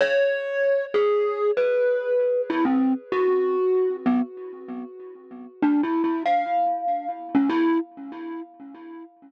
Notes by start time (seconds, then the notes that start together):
0.01 C#5
0.94 G#4
1.57 B4
2.50 E4
2.65 C4
3.12 F#4
4.06 B3
5.62 D4
5.83 E4
6.04 E4
6.26 F5
7.35 C#4
7.49 E4